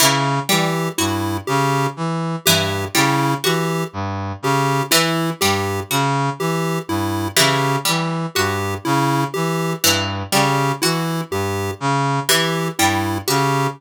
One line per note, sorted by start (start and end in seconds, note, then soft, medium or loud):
0.00 0.40 C#3 medium
0.00 0.39 E3 medium
0.49 0.88 E3 medium
0.49 0.88 G3 medium
0.49 0.89 G4 medium
0.98 1.38 G2 medium
0.98 1.38 E4 medium
0.98 1.38 F#4 medium
1.47 1.87 C#3 medium
1.47 1.86 G4 medium
1.97 2.36 E3 medium
2.45 2.85 G2 medium
2.45 2.86 E3 medium
2.45 2.85 G4 medium
2.95 3.34 C#3 medium
2.95 3.34 G3 medium
2.95 3.34 E4 medium
3.44 3.84 E3 medium
3.44 3.83 F#4 medium
3.44 3.84 G4 medium
3.93 4.33 G2 medium
4.42 4.82 C#3 medium
4.42 4.83 G4 medium
4.91 5.31 E3 medium
4.91 5.30 E4 medium
5.41 5.81 G2 medium
5.41 5.81 G3 medium
5.41 5.80 G4 medium
5.90 6.30 C#3 medium
5.90 6.30 F#4 medium
6.39 6.78 E3 medium
6.39 6.79 G4 medium
6.88 7.28 G2 medium
6.88 7.28 E4 medium
7.36 7.77 C#3 medium
7.36 7.76 E3 medium
7.36 7.76 G4 medium
7.85 8.26 E3 medium
7.85 8.24 G3 medium
8.35 8.75 G2 medium
8.35 8.75 F#4 medium
8.35 8.74 G4 medium
8.85 9.25 C#3 medium
8.85 9.24 E4 medium
9.34 9.74 E3 medium
9.34 9.73 G4 medium
9.84 10.23 G2 medium
9.84 10.23 E3 medium
10.32 10.72 C#3 medium
10.32 10.72 G3 medium
10.32 10.72 G4 medium
10.82 11.22 E3 medium
10.82 11.21 E4 medium
10.82 11.22 F#4 medium
11.31 11.70 G2 medium
11.31 11.71 G4 medium
11.80 12.20 C#3 medium
12.29 12.68 E3 medium
12.29 12.69 E3 medium
12.29 12.68 G4 medium
12.79 13.18 G2 medium
12.79 13.18 G3 medium
12.79 13.18 E4 medium
13.28 13.67 C#3 medium
13.28 13.67 F#4 medium
13.28 13.67 G4 medium